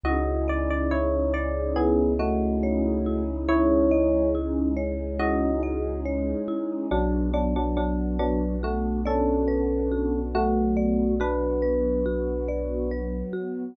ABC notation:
X:1
M:4/4
L:1/16
Q:1/4=70
K:Bdor
V:1 name="Electric Piano 1"
[F^d]2 =d d [Ec]2 d2 [B,G]2 [A,F]6 | [Ec]4 z4 [F^d]4 z4 | [F,D]2 [F,D] [F,D] [F,D]2 [F,D]2 [A,F]2 [CA]6 | [A,F]4 [DB]10 z2 |]
V:2 name="Marimba"
E2 ^d2 E2 c2 E2 d2 c2 E2 | E2 ^d2 E2 c2 E2 d2 c2 E2 | F2 d2 F2 B2 F2 d2 B2 F2 | F2 d2 F2 B2 F2 d2 B2 F2 |]
V:3 name="Synth Bass 2" clef=bass
C,,16- | C,,16 | B,,,16- | B,,,16 |]
V:4 name="Pad 2 (warm)"
[C^DEG]16 | [G,C^DG]16 | [B,DF]16 | [F,B,F]16 |]